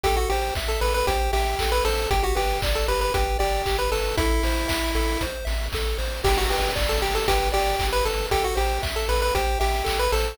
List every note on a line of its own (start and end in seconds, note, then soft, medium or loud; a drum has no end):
0.03 0.26 A1 medium
0.03 0.16 G4 medium
0.03 0.29 A4 medium
0.03 kick loud
0.03 closed hi-hat loud
0.17 0.29 F#4 medium
0.30 0.52 A1 medium
0.30 0.54 G4 medium
0.30 0.55 C5 medium
0.30 open hi-hat medium
0.55 0.77 A1 medium
0.55 0.80 E5 medium
0.55 kick loud
0.55 clap loud
0.68 0.81 A4 medium
0.81 1.03 A1 medium
0.81 1.05 A4 medium
0.81 0.93 B4 medium
0.81 open hi-hat medium
0.94 1.06 B4 medium
1.07 1.29 A1 medium
1.07 1.32 G4 medium
1.07 1.31 C5 medium
1.07 kick loud
1.07 closed hi-hat loud
1.33 1.55 A1 medium
1.33 1.71 G4 medium
1.33 1.56 E5 medium
1.33 open hi-hat medium
1.59 1.81 A1 medium
1.59 1.83 A4 medium
1.59 kick medium
1.59 clap loud
1.72 1.84 B4 medium
1.85 2.07 A1 medium
1.85 2.09 A4 medium
1.85 2.08 C5 medium
1.85 open hi-hat loud
2.11 2.33 G1 medium
2.11 2.23 G4 medium
2.11 2.36 G4 loud
2.11 kick loud
2.11 closed hi-hat loud
2.23 2.36 F#4 medium
2.35 2.59 G1 medium
2.35 2.61 G4 medium
2.35 2.58 B4 medium
2.35 open hi-hat loud
2.62 2.84 G1 medium
2.62 2.86 D5 medium
2.62 kick loud
2.62 clap loud
2.75 2.88 A4 medium
2.88 3.10 G1 medium
2.88 3.12 G4 medium
2.88 3.01 B4 medium
2.88 open hi-hat medium
3.01 3.13 B4 medium
3.14 3.36 G1 medium
3.14 3.38 G4 medium
3.14 3.37 B4 medium
3.14 kick loud
3.14 closed hi-hat loud
3.39 3.62 G1 medium
3.39 3.77 G4 medium
3.39 3.62 D5 medium
3.39 open hi-hat medium
3.66 3.88 G1 medium
3.66 3.90 G4 medium
3.66 kick medium
3.66 clap loud
3.79 3.91 B4 medium
3.92 4.14 G1 medium
3.92 4.16 A4 medium
3.92 4.16 B4 medium
3.92 open hi-hat loud
4.17 4.40 A1 medium
4.17 5.23 E4 medium
4.17 4.43 A4 medium
4.17 kick loud
4.17 closed hi-hat loud
4.43 4.65 A1 medium
4.43 4.68 C5 medium
4.43 open hi-hat loud
4.68 4.91 A1 medium
4.68 4.91 E5 medium
4.68 kick loud
4.68 clap loud
4.95 5.17 A1 medium
4.95 5.18 A4 medium
4.95 open hi-hat medium
5.21 5.43 A1 medium
5.21 5.45 C5 medium
5.21 kick medium
5.21 closed hi-hat loud
5.45 5.69 A1 medium
5.45 5.68 E5 medium
5.45 open hi-hat medium
5.72 5.95 A1 medium
5.72 5.98 A4 medium
5.72 kick loud
5.72 clap loud
5.98 6.21 A1 medium
5.98 6.21 C5 medium
5.98 open hi-hat medium
6.24 6.46 G1 medium
6.24 6.47 G4 loud
6.24 6.37 G4 medium
6.24 kick loud
6.24 crash loud
6.37 6.50 F#4 medium
6.50 6.72 G1 medium
6.50 6.72 G4 medium
6.50 6.74 B4 medium
6.50 open hi-hat medium
6.76 6.98 G1 medium
6.76 6.99 D5 medium
6.76 kick loud
6.76 clap loud
6.89 7.01 A4 medium
7.02 7.24 G1 medium
7.02 7.14 G4 medium
7.02 7.25 G4 medium
7.02 open hi-hat medium
7.15 7.27 A4 medium
7.28 7.50 G1 medium
7.28 7.49 G4 medium
7.28 7.52 B4 medium
7.28 kick loud
7.28 closed hi-hat loud
7.52 7.76 G1 medium
7.52 7.87 G4 medium
7.52 7.75 D5 medium
7.52 open hi-hat medium
7.79 8.01 G1 medium
7.79 8.04 G4 medium
7.79 kick loud
7.79 clap loud
7.93 8.05 B4 medium
8.05 8.27 G1 medium
8.05 8.26 A4 medium
8.05 8.29 B4 medium
8.05 open hi-hat medium
8.31 8.53 A1 medium
8.31 8.44 G4 medium
8.31 8.55 A4 medium
8.31 kick loud
8.31 closed hi-hat loud
8.44 8.56 F#4 medium
8.55 8.79 A1 medium
8.55 8.82 G4 medium
8.55 8.79 C5 medium
8.55 open hi-hat medium
8.82 9.05 A1 medium
8.82 9.06 E5 medium
8.82 kick loud
8.82 clap loud
8.96 9.08 A4 medium
9.09 9.31 A1 medium
9.09 9.32 A4 medium
9.09 9.21 B4 medium
9.09 open hi-hat medium
9.22 9.34 B4 medium
9.35 9.57 A1 medium
9.35 9.59 G4 medium
9.35 9.58 C5 medium
9.35 kick loud
9.35 closed hi-hat loud
9.60 9.83 A1 medium
9.60 9.98 G4 medium
9.60 9.83 E5 medium
9.60 open hi-hat medium
9.84 10.09 A1 medium
9.84 10.08 A4 medium
9.84 kick medium
9.84 clap loud
9.99 10.12 B4 medium
10.12 10.34 A1 medium
10.12 10.37 A4 medium
10.12 10.36 C5 medium
10.12 open hi-hat loud